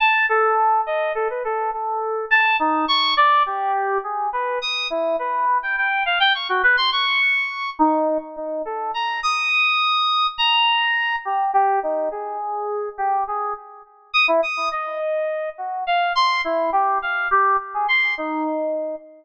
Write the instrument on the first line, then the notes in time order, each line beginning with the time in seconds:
electric piano 2
0.00 A5
0.29 A4
0.86 D#5
1.15 A4
1.30 B4
1.44 A4
1.73 A4
2.31 A5
2.59 D#4
2.88 C#6
3.17 D5
3.46 G4
4.04 G#4
4.33 B4
4.62 D#6
4.90 E4
5.19 B4
5.63 G5
5.77 G5
6.06 F5
6.20 G5
6.34 C#6
6.49 F#4
6.63 B4
6.77 C6
6.92 C#6
7.79 D#4
8.36 D#4
8.65 A4
8.94 A#5
9.23 D#6
10.38 A#5
11.25 G4
11.54 G4
11.83 D#4
12.11 G#4
12.98 G4
13.28 G#4
14.13 D#6
14.28 E4
14.43 D#6
14.72 D#5
15.58 F#4
15.87 F5
16.15 C6
16.44 E4
16.72 G4
17.02 F5
17.31 G4
17.74 G#4
17.88 C6
18.18 D#4